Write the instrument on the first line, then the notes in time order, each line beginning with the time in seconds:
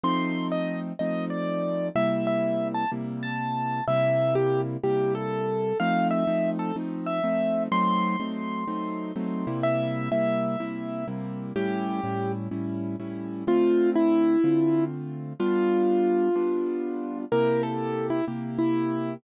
acoustic grand piano
0.04 F3 A3 C4 D#4 C6
0.52 D#5
0.99 F3 A3 C4 D#4 D#5
1.30 D5
1.95 C3 G3 A#3 E4 E5
2.27 E5
2.74 A5
2.92 C3 G3 A#3 E4
3.23 A5
3.88 C3 G3 A#3 E4 E5
4.35 G4
4.83 C3 G3 A#3 E4 G4
5.15 A4
5.80 F3 A3 C4 D#4 F5
6.11 E5
6.27 F3 A3 C4 D#4
6.59 A4
6.76 F3 A3 C4 D#4
7.06 E5
7.24 F3 A3 C4 D#4
7.71 F#3 A3 C4 D#4 C6
8.20 F#3 A3 C4 D#4
8.68 F#3 A3 C4 D#4
9.16 F#3 A3 C4 D#4
9.47 C3 G3 A#3 E4
9.63 E5
10.11 C3 G3 A#3 E4 E5
10.60 C3 G3 A#3 E4
11.08 C3 G3 A#3 E4
11.56 A2 G3 C#4 E4 G4
12.04 A2 G3 C#4 E4
12.51 A2 G3 C#4 E4
13.00 A2 G3 C#4 E4
13.47 D3 A3 C4 F4
13.96 E4
14.44 D3 A3 C4 F4
15.39 G3 B3 D4 F4
16.36 G3 B3 D4 F4
17.32 C3 A#3 E4 G4 A#4
17.63 A4
18.10 E4
18.28 C3 A#3 E4 G4
18.59 E4